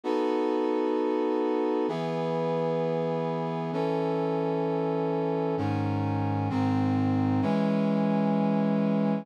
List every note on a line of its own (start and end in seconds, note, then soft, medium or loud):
0.04 1.86 B3 medium
0.04 1.86 D#4 medium
0.04 1.86 F#4 medium
0.04 1.86 A4 medium
1.88 3.71 E3 medium
1.88 3.71 B3 medium
1.88 3.71 G#4 medium
3.73 5.55 E3 medium
3.73 5.55 C#4 medium
3.73 5.55 A4 medium
5.57 6.49 G#2 medium
5.57 6.49 D#3 medium
5.57 6.49 C#4 medium
6.50 7.41 G#2 medium
6.50 7.41 D#3 medium
6.50 7.41 C4 loud
7.42 9.25 E3 loud
7.42 9.25 G#3 medium
7.42 9.25 C#4 medium